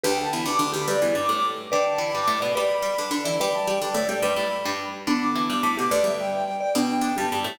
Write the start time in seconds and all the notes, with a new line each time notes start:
0.03 D2 D3 G4 B4 G5
0.17 A5
0.32 E2 E3 B5
0.45 D2 D3 D6
0.59 D2 D3
0.73 D2 D3 G4 B5
0.87 G2 G3 G4 B4 D5
1.02 E2 E3
1.15 G2 G3 D6
1.29 A2 A3
1.71 D3 D4 B4 D5 G5
1.85 A5
1.98 E3 E4 B5
2.13 G2 G3 D6
2.28 A2 A3
2.40 B2 B3 D5 B5
2.55 G3 G4 B4 D5 B5
2.82 G3 G4
2.98 D3 D4
3.11 D3 D4
3.24 E3 E4 D5
3.39 G3 G4 B4 D5 B5
3.53 A5
3.67 G3 G4 G5
3.81 D3 D4 D5
3.94 A2 A3
4.09 G3 G4 D5 G5
4.22 G2 G3 B4 D5 B5
4.36 A2 A3
4.65 G2 G3
5.07 D3 B3 D4 B5
5.21 D6
5.35 E3 E4 D6
5.49 G2 G3 D6
5.63 A2 A3
5.77 B2 B3 G4 D6
5.91 D2 D3 B4 D5
6.04 G2 G3 E5
6.19 G5
6.33 G5
6.60 D5 G5
6.75 B2 B3 D4 G5
7.01 D3 D4
7.16 G2 G3 G4 A5
7.32 G2 G3
7.44 A2 A3